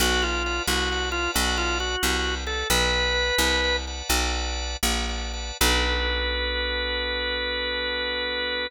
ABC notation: X:1
M:12/8
L:1/8
Q:3/8=89
K:Bm
V:1 name="Drawbar Organ"
F ^E2 F2 E F E F3 A | "^rit." B5 z7 | B12 |]
V:2 name="Drawbar Organ"
[Bdfa] [Bdfa] [Bdfa] [Bdfa] [Bdfa] [Bdfa] [Bdfa]3 [Bdfa] [Bdfa] [Bdfa] | "^rit." [Bdfa] [Bdfa] [Bdfa] [Bdfa] [Bdfa] [Bdfa] [Bdfa]3 [Bdfa] [Bdfa] [Bdfa] | [B,DFA]12 |]
V:3 name="Electric Bass (finger)" clef=bass
B,,,3 =C,,3 B,,,3 C,,3 | "^rit." B,,,3 =C,,3 B,,,3 ^A,,,3 | B,,,12 |]